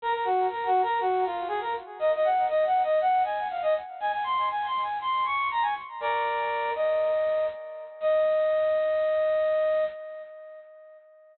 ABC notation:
X:1
M:4/4
L:1/16
Q:1/4=120
K:Ebdor
V:1 name="Brass Section"
B B G2 (3B2 G2 B2 G2 F2 A B z2 | e e g2 (3e2 g2 e2 g2 a2 f e z2 | a a c'2 (3a2 c'2 a2 c'2 d'2 b a z2 | [B=d]6 e6 z4 |
e16 |]